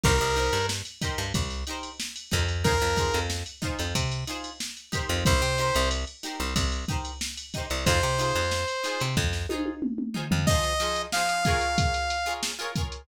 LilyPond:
<<
  \new Staff \with { instrumentName = "Lead 2 (sawtooth)" } { \time 4/4 \key c \minor \tempo 4 = 92 bes'4 r2. | bes'4 r2. | c''4 r2. | c''2 r2 |
\key f \minor ees''4 f''2 r4 | }
  \new Staff \with { instrumentName = "Acoustic Guitar (steel)" } { \time 4/4 \key c \minor <ees' g' bes' c''>8 <ees' g' bes' c''>4 <ees' g' bes' c''>4 <ees' g' bes' c''>4 <ees' g' bes' c''>8 | <ees' f' aes' c''>8 <ees' f' aes' c''>4 <ees' f' aes' c''>4 <ees' f' aes' c''>4 <ees' g' bes' c''>8~ | <ees' g' bes' c''>8 <ees' g' bes' c''>4 <ees' g' bes' c''>4 <ees' g' bes' c''>4 <ees' g' bes' c''>8 | <ees' f' aes' c''>8 <ees' f' aes' c''>4 <ees' f' aes' c''>4 <ees' f' aes' c''>4 <ees' f' aes' c''>8 |
\key f \minor <f ees' aes' c''>8 <f ees' aes' c''>8 <f ees' aes' c''>8 <f' aes' bes' des''>4~ <f' aes' bes' des''>16 <f' aes' bes' des''>8 <f' aes' bes' des''>16 <f' aes' bes' des''>8 | }
  \new Staff \with { instrumentName = "Electric Bass (finger)" } { \clef bass \time 4/4 \key c \minor c,16 c,8 g,4 g,16 c,4. f,8~ | f,16 f,8 f,4 f,16 c4.~ c16 f,16 | c,16 c8 c,4 c,16 c,4.~ c,16 c,16 | f,16 c8 f,4 c16 f,4.~ f,16 f,16 |
\key f \minor r1 | }
  \new DrumStaff \with { instrumentName = "Drums" } \drummode { \time 4/4 <cymc bd>16 cymr16 cymr16 cymr16 sn16 cymr16 <bd cymr sn>16 cymr16 <bd cymr>16 <cymr sn>16 cymr16 cymr16 sn16 cymr16 <bd cymr>16 cymr16 | <bd cymr>16 <cymr sn>16 <bd cymr sn>16 cymr16 sn16 cymr16 <bd cymr sn>16 cymr16 <bd cymr>16 cymr16 cymr16 cymr16 sn16 cymr16 <bd cymr sn>16 <cymr sn>16 | <bd cymr>16 cymr16 cymr16 cymr16 cymr16 cymr16 <cymr sn>16 cymr16 <bd cymr>16 cymr16 <bd cymr>16 cymr16 sn16 cymr16 <bd cymr>16 cymr16 | <bd cymr>16 cymr16 cymr16 <cymr sn>16 sn16 cymr16 <cymr sn>16 cymr16 <bd sn>16 sn16 tommh16 tommh16 toml16 toml16 tomfh16 tomfh16 |
<cymc bd>16 <hh sn>16 <hh sn>16 hh16 sn16 hh16 <hh bd sn>16 hh16 <hh bd>16 hh16 hh16 hh16 sn16 <hh sn>16 <hh bd>16 hh16 | }
>>